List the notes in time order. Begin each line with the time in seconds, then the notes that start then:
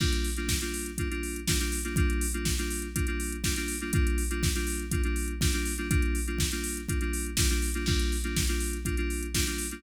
0.00 G3 A#3 D4 F4, kick, crash
0.13 closed hi-hat
0.24 open hi-hat
0.36 G3 A#3 D4 F4, closed hi-hat
0.48 kick, snare
0.61 G3 A#3 D4 F4, closed hi-hat
0.74 open hi-hat
0.86 closed hi-hat
0.98 G3 A#3 D4 F4, kick, closed hi-hat
1.11 G3 A#3 D4 F4, closed hi-hat
1.23 open hi-hat
1.36 closed hi-hat
1.47 G3 A#3 D4 F4, kick, snare
1.60 G3 A#3 D4 F4, closed hi-hat
1.72 open hi-hat
1.84 G3 A#3 D4 F4, closed hi-hat
1.96 G3 A#3 D4 F4, kick, closed hi-hat
2.10 closed hi-hat
2.21 open hi-hat
2.34 G3 A#3 D4 F4, closed hi-hat
2.45 kick, snare
2.58 G3 A#3 D4 F4, closed hi-hat
2.70 open hi-hat
2.82 closed hi-hat
2.95 G3 A#3 D4 F4, kick, closed hi-hat
3.07 G3 A#3 D4 F4, closed hi-hat
3.20 open hi-hat
3.32 closed hi-hat
3.44 G3 A#3 D4 F4, kick, snare
3.56 G3 A#3 D4 F4, closed hi-hat
3.68 open hi-hat
3.80 G3 A#3 D4 F4, closed hi-hat
3.93 G3 A#3 D4 F4, kick, closed hi-hat
4.07 closed hi-hat
4.18 open hi-hat
4.30 G3 A#3 D4 F4, closed hi-hat
4.43 kick, snare
4.55 G3 A#3 D4 F4, closed hi-hat
4.67 open hi-hat
4.79 closed hi-hat
4.91 G3 A#3 D4 F4, kick, closed hi-hat
5.03 G3 A#3 D4 F4, closed hi-hat
5.16 open hi-hat
5.28 closed hi-hat
5.41 G3 A#3 D4 F4, kick, snare
5.53 G3 A#3 D4 F4, closed hi-hat
5.65 open hi-hat
5.78 G3 A#3 D4 F4, closed hi-hat
5.90 G3 A#3 D4 F4, kick, closed hi-hat
6.02 closed hi-hat
6.15 open hi-hat
6.27 G3 A#3 D4 F4, closed hi-hat
6.39 kick, snare
6.52 G3 A#3 D4 F4, closed hi-hat
6.64 open hi-hat
6.77 closed hi-hat
6.89 G3 A#3 D4 F4, kick, closed hi-hat
7.01 G3 A#3 D4 F4, closed hi-hat
7.13 open hi-hat
7.26 closed hi-hat
7.37 G3 A#3 D4 F4, kick, snare
7.50 G3 A#3 D4 F4, closed hi-hat
7.62 open hi-hat
7.74 G3 A#3 D4 F4, closed hi-hat
7.86 G3 A#3 D4 F4, kick, crash
7.99 closed hi-hat
8.12 open hi-hat
8.24 G3 A#3 D4 F4, closed hi-hat
8.36 kick, snare
8.47 G3 A#3 D4 F4, closed hi-hat
8.60 open hi-hat
8.73 closed hi-hat
8.85 G3 A#3 D4 F4, kick, closed hi-hat
8.97 G3 A#3 D4 F4, closed hi-hat
9.10 open hi-hat
9.23 closed hi-hat
9.35 G3 A#3 D4 F4, kick, snare
9.47 G3 A#3 D4 F4, closed hi-hat
9.58 open hi-hat
9.71 G3 A#3 D4 F4, closed hi-hat